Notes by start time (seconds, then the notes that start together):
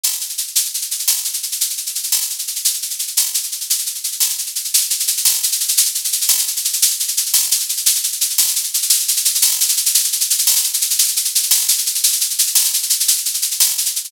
0.04 tambourine, shaker
0.12 shaker
0.21 shaker
0.29 shaker
0.38 shaker
0.47 shaker
0.56 shaker
0.65 shaker
0.74 shaker
0.82 shaker
0.91 shaker
0.99 shaker
1.08 tambourine, shaker
1.17 shaker
1.24 shaker
1.33 shaker
1.43 shaker
1.52 shaker
1.61 shaker
1.70 shaker
1.77 shaker
1.86 shaker
1.95 shaker
2.03 shaker
2.12 tambourine, shaker
2.22 shaker
2.30 shaker
2.39 shaker
2.47 shaker
2.56 shaker
2.65 shaker
2.74 shaker
2.82 shaker
2.90 shaker
2.99 shaker
3.07 shaker
3.17 tambourine, shaker
3.26 shaker
3.34 shaker
3.43 shaker
3.52 shaker
3.61 shaker
3.70 shaker
3.79 shaker
3.86 shaker
3.95 shaker
4.04 shaker
4.12 shaker
4.20 tambourine, shaker
4.30 shaker
4.38 shaker
4.46 shaker
4.55 shaker
4.64 shaker
4.74 shaker
4.81 shaker
4.90 shaker
5.00 shaker
5.07 shaker
5.17 shaker
5.25 tambourine, shaker
5.34 shaker
5.43 shaker
5.52 shaker
5.60 shaker
5.68 shaker
5.77 shaker
5.85 shaker
5.95 shaker
6.04 shaker
6.12 shaker
6.21 shaker
6.29 tambourine, shaker
6.38 shaker
6.47 shaker
6.56 shaker
6.65 shaker
6.73 shaker
6.82 shaker
6.90 shaker
7.00 shaker
7.08 shaker
7.17 shaker
7.26 shaker
7.34 tambourine, shaker
7.43 shaker
7.51 shaker
7.60 shaker
7.69 shaker
7.77 shaker
7.86 shaker
7.95 shaker
8.04 shaker
8.12 shaker
8.21 shaker
8.30 shaker
8.38 tambourine, shaker
8.48 shaker
8.56 shaker
8.64 shaker
8.74 shaker
8.82 shaker
8.90 shaker
9.00 shaker
9.08 shaker
9.16 shaker
9.25 shaker
9.35 shaker
9.42 tambourine, shaker
9.51 shaker
9.61 shaker
9.68 shaker
9.77 shaker
9.86 shaker
9.95 shaker
10.04 shaker
10.12 shaker
10.21 shaker
10.30 shaker
10.38 shaker
10.47 tambourine, shaker
10.56 shaker
10.64 shaker
10.74 shaker
10.81 shaker
10.90 shaker
10.99 shaker
11.08 shaker
11.16 shaker
11.25 shaker
11.35 shaker
11.43 shaker
11.51 tambourine, shaker
11.61 shaker
11.68 shaker
11.78 shaker
11.86 shaker
11.95 shaker
12.04 shaker
12.12 shaker
12.21 shaker
12.30 shaker
12.39 shaker
12.47 shaker
12.55 tambourine, shaker
12.64 shaker
12.74 shaker
12.83 shaker
12.90 shaker
13.00 shaker
13.08 shaker
13.18 shaker
13.25 shaker
13.34 shaker
13.42 shaker
13.51 shaker
13.60 tambourine, shaker
13.69 shaker
13.78 shaker
13.86 shaker
13.96 shaker
14.04 shaker